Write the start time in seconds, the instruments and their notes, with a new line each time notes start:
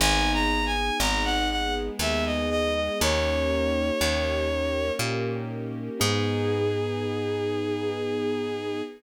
0.00 electric bass (finger) G#1, acoustic grand piano B3 D#4 G#4, string ensemble 1 B3 D#4 G#4, violin G#5
0.33 violin A#5
0.66 violin G#5
1.00 electric bass (finger) G#1, acoustic grand piano B3 D#4 G#4, violin A#5
1.25 violin F#5
1.51 string ensemble 1 G#3 B3 G#4, violin F#5
1.99 electric bass (finger) D#2, acoustic grand piano B3 D#4 G#4, violin E5
2.25 violin D#5
2.50 violin D#5
2.75 violin D#5
3.00 electric bass (finger) D#2, string ensemble 1 A#3 C#4 D#4 G4, acoustic grand piano A#3 C#4 D#4 G4, violin C#5
4.01 electric bass (finger) D#2, acoustic grand piano A#3 C#4 D#4 G4
4.51 string ensemble 1 A#3 C#4 G4 A#4
4.99 electric bass (finger) A#2, acoustic grand piano A#3 C#4 D#4 G4
6.00 electric bass (finger) G#2, acoustic grand piano B3 D#4 G#4, string ensemble 1 B3 D#4 G#4, violin G#4